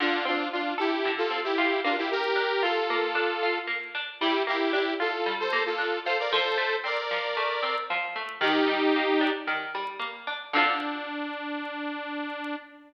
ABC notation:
X:1
M:4/4
L:1/16
Q:1/4=114
K:Dm
V:1 name="Lead 2 (sawtooth)"
[DF]2 [DF]2 [DF]2 [EG]3 [FA]2 [EG]3 [DF] [EG] | [GB]4 [FA]8 z4 | [EG]2 [EG]2 [EG]2 [FA]3 [Ac]2 [FA]3 [Ac] [Bd] | [Ac]4 [Bd]8 z4 |
[_EG]8 z8 | D16 |]
V:2 name="Pizzicato Strings"
D,2 C2 F2 A2 D,2 C2 F2 B,2- | B,2 D2 F2 B,2 D2 F2 B,2 D2 | G,2 B,2 D2 F2 G,2 B,2 D2 F2 | F,2 A,2 C2 F,2 A,2 C2 F,2 A,2 |
_E,2 G,2 B,2 D2 E,2 G,2 B,2 D2 | [D,CFA]16 |]